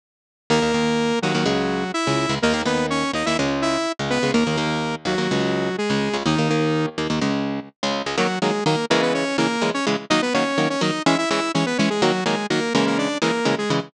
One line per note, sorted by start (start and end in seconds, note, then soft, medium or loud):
0.50 0.60 D#2 medium
0.50 0.60 D#3 medium
0.50 0.60 A#3 medium
0.50 1.19 A#3 medium
0.50 1.19 A#4 medium
0.62 0.72 D#2 medium
0.62 0.72 D#3 medium
0.62 0.72 A#3 medium
0.74 1.12 D#2 medium
0.74 1.12 D#3 medium
0.74 1.12 A#3 medium
1.22 1.33 D#2 medium
1.22 1.33 D#3 medium
1.22 1.92 F#3 medium
1.22 1.33 A#3 medium
1.22 1.92 F#4 medium
1.34 1.44 D#2 medium
1.34 1.44 D#3 medium
1.34 1.44 A#3 medium
1.46 1.84 C#2 medium
1.46 1.84 C#3 medium
1.46 1.84 G#3 medium
1.94 2.35 E4 medium
1.94 2.35 E5 medium
2.07 2.26 C#2 medium
2.07 2.26 C#3 medium
2.07 2.26 G#3 medium
2.29 2.39 C#2 medium
2.29 2.39 C#3 medium
2.29 2.39 G#3 medium
2.42 2.53 D#2 medium
2.42 2.53 D#3 medium
2.42 2.62 A#3 medium
2.42 2.53 A#3 medium
2.42 2.62 A#4 medium
2.54 2.63 D#2 medium
2.54 2.63 D#3 medium
2.54 2.63 A#3 medium
2.65 3.04 D#2 medium
2.65 3.04 D#3 medium
2.65 3.04 A#3 medium
2.65 2.86 B3 medium
2.65 2.86 B4 medium
2.90 3.12 C#4 medium
2.90 3.12 C#5 medium
3.13 3.23 D#2 medium
3.13 3.23 D#3 medium
3.13 3.23 A#3 medium
3.13 3.26 D#4 medium
3.13 3.26 D#5 medium
3.26 3.36 D#2 medium
3.26 3.36 D#3 medium
3.26 3.36 A#3 medium
3.26 3.37 E4 medium
3.26 3.37 E5 medium
3.39 3.77 C#2 medium
3.39 3.77 C#3 medium
3.39 3.77 G#3 medium
3.62 3.92 E4 medium
3.62 3.92 E5 medium
3.99 4.19 C#2 medium
3.99 4.19 C#3 medium
3.99 4.19 G#3 medium
4.10 4.31 B3 medium
4.10 4.31 B4 medium
4.23 4.32 C#2 medium
4.23 4.32 C#3 medium
4.23 4.32 G#3 medium
4.34 4.44 D#2 medium
4.34 4.44 D#3 medium
4.34 4.44 A#3 medium
4.34 4.95 A#3 medium
4.34 4.95 A#4 medium
4.47 4.56 D#2 medium
4.47 4.56 D#3 medium
4.47 4.56 A#3 medium
4.57 4.96 D#2 medium
4.57 4.96 D#3 medium
4.57 4.96 A#3 medium
5.05 5.15 D#2 medium
5.05 5.15 D#3 medium
5.05 5.76 F#3 medium
5.05 5.15 A#3 medium
5.05 5.76 F#4 medium
5.18 5.28 D#2 medium
5.18 5.28 D#3 medium
5.18 5.28 A#3 medium
5.31 5.69 C#2 medium
5.31 5.69 C#3 medium
5.31 5.69 G#3 medium
5.78 6.17 G#3 medium
5.78 6.17 G#4 medium
5.90 6.09 C#2 medium
5.90 6.09 C#3 medium
5.90 6.09 G#3 medium
6.13 6.23 C#2 medium
6.13 6.23 C#3 medium
6.13 6.23 G#3 medium
6.25 6.35 D#2 medium
6.25 6.35 D#3 medium
6.25 6.86 D#3 medium
6.25 6.35 A#3 medium
6.25 6.86 D#4 medium
6.38 6.48 D#2 medium
6.38 6.48 D#3 medium
6.38 6.48 A#3 medium
6.50 6.89 D#2 medium
6.50 6.89 D#3 medium
6.50 6.89 A#3 medium
6.98 7.07 D#2 medium
6.98 7.07 D#3 medium
6.98 7.07 A#3 medium
7.10 7.19 D#2 medium
7.10 7.19 D#3 medium
7.10 7.19 A#3 medium
7.21 7.60 C#2 medium
7.21 7.60 C#3 medium
7.21 7.60 G#3 medium
7.83 8.02 C#2 medium
7.83 8.02 C#3 medium
7.83 8.02 G#3 medium
8.06 8.16 C#2 medium
8.06 8.16 C#3 medium
8.06 8.16 G#3 medium
8.18 8.27 D#3 medium
8.18 8.27 F#3 loud
8.18 8.39 F#3 medium
8.18 8.27 A#3 loud
8.18 8.39 F#4 medium
8.42 8.51 D#3 medium
8.42 8.51 F#3 medium
8.42 8.64 G#3 medium
8.42 8.51 A#3 medium
8.42 8.64 G#4 medium
8.66 8.75 D#3 medium
8.66 8.75 F#3 medium
8.66 8.75 A#3 medium
8.66 8.85 A#3 medium
8.66 8.85 A#4 medium
8.90 9.24 C#3 loud
8.90 9.24 E3 loud
8.90 9.24 G#3 loud
8.90 9.02 A#3 medium
8.90 9.02 A#4 medium
9.02 9.13 B3 medium
9.02 9.13 B4 medium
9.14 9.37 C#4 medium
9.14 9.37 C#5 medium
9.38 9.47 C#3 medium
9.38 9.47 E3 medium
9.38 9.47 G#3 medium
9.38 9.70 A#3 medium
9.38 9.70 A#4 medium
9.62 9.71 C#3 medium
9.62 9.71 E3 medium
9.62 9.71 G#3 medium
9.74 9.86 C#4 medium
9.74 9.86 C#5 medium
9.87 9.96 C#3 medium
9.87 9.96 E3 medium
9.87 9.96 G#3 medium
10.10 10.20 D#3 loud
10.10 10.20 F#3 loud
10.10 10.20 A#3 loud
10.10 10.21 D#4 medium
10.10 10.21 D#5 medium
10.22 10.34 B3 medium
10.22 10.34 B4 medium
10.34 10.44 D#3 medium
10.34 10.44 F#3 medium
10.34 10.44 A#3 medium
10.34 10.69 C#4 medium
10.34 10.69 C#5 medium
10.58 10.67 D#3 medium
10.58 10.67 F#3 medium
10.58 10.67 A#3 medium
10.70 10.81 C#4 medium
10.70 10.81 C#5 medium
10.81 10.91 D#3 medium
10.81 10.91 F#3 medium
10.81 10.91 A#3 medium
10.81 11.03 D#4 medium
10.81 11.03 D#5 medium
11.06 11.16 E3 loud
11.06 11.16 G#3 loud
11.06 11.16 C#4 loud
11.06 11.18 E4 medium
11.06 11.18 E5 medium
11.18 11.29 E4 medium
11.18 11.29 E5 medium
11.30 11.40 E3 loud
11.30 11.40 G#3 medium
11.30 11.40 C#4 medium
11.30 11.52 E4 medium
11.30 11.52 E5 medium
11.54 11.64 E3 medium
11.54 11.64 G#3 medium
11.54 11.66 C#4 medium
11.54 11.64 C#4 medium
11.54 11.66 C#5 medium
11.66 11.78 B3 medium
11.66 11.78 B4 medium
11.78 11.89 E3 medium
11.78 11.89 G#3 loud
11.78 11.89 C#4 medium
11.78 11.89 C#5 medium
11.90 12.02 G#3 medium
11.90 12.02 G#4 medium
12.02 12.12 D#3 loud
12.02 12.12 F#3 loud
12.02 12.24 F#3 medium
12.02 12.12 A#3 loud
12.02 12.24 F#4 medium
12.26 12.35 D#3 medium
12.26 12.35 F#3 medium
12.26 12.46 G#3 medium
12.26 12.35 A#3 medium
12.26 12.46 G#4 medium
12.50 12.60 D#3 medium
12.50 12.60 F#3 medium
12.50 12.73 A#3 medium
12.50 12.60 A#3 medium
12.50 12.73 A#4 medium
12.74 13.08 C#3 loud
12.74 13.08 E3 loud
12.74 13.08 G#3 loud
12.74 12.86 A#3 medium
12.74 12.86 A#4 medium
12.87 12.98 A#3 medium
12.87 12.98 A#4 medium
12.98 13.18 D4 medium
12.98 13.18 D5 medium
13.22 13.31 C#3 medium
13.22 13.31 E3 medium
13.22 13.31 G#3 medium
13.22 13.55 A#3 medium
13.22 13.55 A#4 medium
13.45 13.55 C#3 medium
13.45 13.55 E3 medium
13.45 13.55 G#3 medium
13.58 13.70 G#3 medium
13.58 13.70 G#4 medium
13.70 13.80 C#3 medium
13.70 13.80 E3 medium
13.70 13.80 G#3 loud